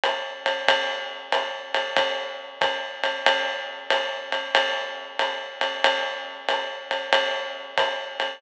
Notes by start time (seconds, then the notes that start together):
0.03 hi-hat pedal, ride
0.46 ride
0.68 kick, ride
1.32 hi-hat pedal, ride
1.74 ride
1.97 kick, ride
2.61 kick, hi-hat pedal, ride
3.03 ride
3.26 ride
3.90 hi-hat pedal, ride
4.32 ride
4.55 ride
5.19 hi-hat pedal, ride
5.61 ride
5.84 ride
6.49 hi-hat pedal, ride
6.91 ride
7.13 ride
7.78 kick, hi-hat pedal, ride
8.20 ride